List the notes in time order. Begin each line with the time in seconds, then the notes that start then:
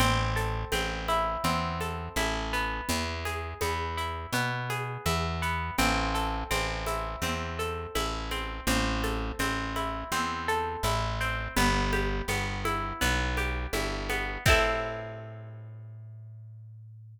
0.00 A1 C4, cowbell, low conga, shaker
0.36 A4, shaker
0.72 A1 C4, cowbell, high conga, shaker
1.08 E4, high conga, shaker
1.44 E2 C4, cowbell, low conga, shaker
1.81 A4, high conga, shaker
2.16 A1 E4, cowbell, high conga, shaker
2.53 B3, shaker
2.89 E2, cowbell, low conga, shaker
3.25 G#4, high conga, shaker
3.61 E2 B3, cowbell, high conga, shaker
3.97 E4, shaker
4.33 B2 B3, cowbell, low conga, shaker
4.70 G#4, high conga, shaker
5.06 E2 E4, cowbell, high conga, shaker
5.42 B3, shaker
5.78 A1 C4, cowbell, low conga, shaker
6.15 A4, shaker
6.51 A1 C4, cowbell, high conga, shaker
6.86 E4, high conga, shaker
7.22 E2 C4, cowbell, low conga, shaker
7.59 A4, shaker
7.95 A1 E4, cowbell, high conga, shaker
8.31 C4, high conga, shaker
8.67 A1 C4, cowbell, low conga, shaker
9.03 A4, high conga, shaker
9.39 A1 C4, cowbell, high conga, shaker
9.76 E4, high conga, shaker
10.12 E2 C4, cowbell, low conga, shaker
10.48 A4, shaker
10.83 A1 E4, cowbell, high conga, shaker
11.20 C4, shaker
11.56 G1 B3, cowbell, low conga, shaker
11.93 G4, high conga, shaker
12.28 G1 B3, cowbell, high conga, shaker
12.65 E4, high conga, shaker
13.01 B1 B3, cowbell, low conga, shaker
13.37 G4, high conga, shaker
13.73 G1 E4, cowbell, high conga, shaker
14.09 B3, high conga, shaker
14.46 A2 C4 E4 A4, kick, crash